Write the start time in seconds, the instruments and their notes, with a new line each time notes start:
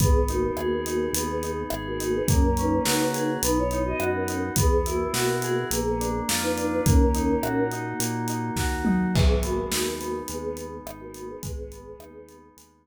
0.00 synth bass 1 G#1, choir aahs B3 G#4, electric piano 2 B3, kick, closed hi-hat
0.28 choir aahs A#3 F#4, electric piano 2 D#4, closed hi-hat
0.57 synth bass 1 D#2, electric piano 2 G#4, cross-stick
0.86 electric piano 2 D#4, closed hi-hat
1.13 synth bass 1 D#2, choir aahs B3 G#4, electric piano 2 B3, closed hi-hat
1.29 choir aahs B3 G#4
1.43 electric piano 2 D#4, closed hi-hat
1.70 synth bass 1 G#1, electric piano 2 G#4, cross-stick
1.87 choir aahs A#3 F#4
2.00 electric piano 2 D#4, closed hi-hat
2.15 choir aahs B3 G#4
2.28 synth bass 1 F#2, electric piano 2 A#3, choir aahs C#4 A#4, kick, closed hi-hat
2.57 electric piano 2 C#4, choir aahs D#4 B4, closed hi-hat
2.85 synth bass 1 C#3, electric piano 2 F#4, snare
3.14 electric piano 2 G#4, closed hi-hat
3.42 synth bass 1 B1, electric piano 2 B3, choir aahs D#4 B4, closed hi-hat
3.57 choir aahs E4 C#5
3.71 electric piano 2 D#4, closed hi-hat
3.85 choir aahs F#4 D#5
3.99 synth bass 1 F#2, electric piano 2 F#4, cross-stick
4.14 choir aahs C#4 A#4
4.28 electric piano 2 D#4, closed hi-hat
4.56 synth bass 1 E2, electric piano 2 B3, choir aahs B3 G#4, kick, closed hi-hat
4.85 choir aahs A#3 F#4, electric piano 2 E4, closed hi-hat
5.13 synth bass 1 B2, electric piano 2 F#4, snare
5.42 electric piano 2 G#4, closed hi-hat
5.71 synth bass 1 A#1, electric piano 2 A#3, choir aahs B3 G#4, closed hi-hat
5.85 choir aahs B3 G#4
6.00 electric piano 2 D4, closed hi-hat
6.29 synth bass 1 F2, electric piano 2 F4, snare
6.42 choir aahs D#4 B4
6.57 electric piano 2 D4, closed hi-hat
6.72 choir aahs D#4 B4
6.85 synth bass 1 D#2, electric piano 2 A#3, choir aahs C#4 A#4, kick, closed hi-hat
7.15 electric piano 2 D#4, closed hi-hat
7.43 synth bass 1 A#2, electric piano 2 F#4, cross-stick
7.71 electric piano 2 D#4, closed hi-hat
8.00 synth bass 1 A#2, electric piano 2 A#3, closed hi-hat
8.28 electric piano 2 D#4, closed hi-hat
8.56 synth bass 1 D#2, electric piano 2 F#4, kick, snare
8.85 electric piano 2 D#4, mid tom
9.14 synth bass 1 G#1, electric piano 2 G#3, choir aahs B3 G#4, kick, crash
9.43 choir aahs A#3 F#4, electric piano 2 B3, closed hi-hat
9.71 synth bass 1 D#2, electric piano 2 D#4, snare
10.00 electric piano 2 B3, closed hi-hat
10.28 synth bass 1 D#2, electric piano 2 G#3, choir aahs B3 G#4, closed hi-hat
10.43 choir aahs B3 G#4
10.57 electric piano 2 B3, closed hi-hat
10.85 synth bass 1 G#1, electric piano 2 D#4, cross-stick
11.00 choir aahs A#3 F#4
11.14 electric piano 2 B3, closed hi-hat
11.28 choir aahs B3 G#4
11.43 synth bass 1 G#1, electric piano 2 G#3, choir aahs B3 G#4, kick, closed hi-hat
11.72 electric piano 2 B3, closed hi-hat
11.99 synth bass 1 D#2, electric piano 2 D#4, cross-stick
12.28 electric piano 2 B3, closed hi-hat
12.57 synth bass 1 D#2, electric piano 2 G#3, closed hi-hat